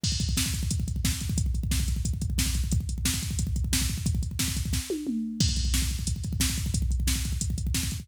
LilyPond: \new DrumStaff \drummode { \time 4/4 \tempo 4 = 179 <cymc bd>16 bd16 <hh bd>16 bd16 <bd sn>16 bd16 <hh bd>16 bd16 <hh bd>16 bd16 <hh bd>16 bd16 <bd sn>16 bd16 <hh bd>16 bd16 | <hh bd>16 bd16 <hh bd>16 bd16 <bd sn>16 bd16 <hh bd>16 bd16 <hh bd>16 bd16 <hh bd>16 bd16 <bd sn>16 bd16 <hh bd>16 bd16 | <hh bd>16 bd16 <hh bd>16 bd16 <bd sn>16 bd16 <hh bd>16 bd16 <hh bd>16 bd16 <hh bd>16 bd16 <bd sn>16 bd16 <hh bd>16 bd16 | <hh bd>16 bd16 <hh bd>16 bd16 <bd sn>16 bd16 <hh bd>16 bd16 <bd sn>8 tommh8 toml4 |
<cymc bd>16 bd16 <hh bd>16 bd16 <bd sn>16 bd16 <hh bd>16 bd16 <hh bd>16 bd16 <hh bd>16 bd16 <bd sn>16 bd16 <hh bd>16 bd16 | <hh bd>16 bd16 <hh bd>16 bd16 <bd sn>16 bd16 <hh bd>16 bd16 <hh bd>16 bd16 <hh bd>16 bd16 <bd sn>16 bd16 <hh bd>16 bd16 | }